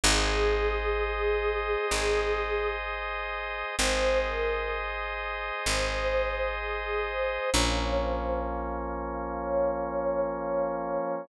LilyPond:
<<
  \new Staff \with { instrumentName = "Choir Aahs" } { \time 4/4 \key aes \major \tempo 4 = 64 aes'2. r4 | c''8 bes'8 r4 c''4 aes'8 c''8 | des''8 c''8 r4 des''4 des''8 des''8 | }
  \new Staff \with { instrumentName = "Drawbar Organ" } { \time 4/4 \key aes \major <aes' c'' ees''>1 | <aes' c'' ees''>1 | <f bes des'>1 | }
  \new Staff \with { instrumentName = "Electric Bass (finger)" } { \clef bass \time 4/4 \key aes \major aes,,2 aes,,2 | aes,,2 aes,,2 | bes,,1 | }
>>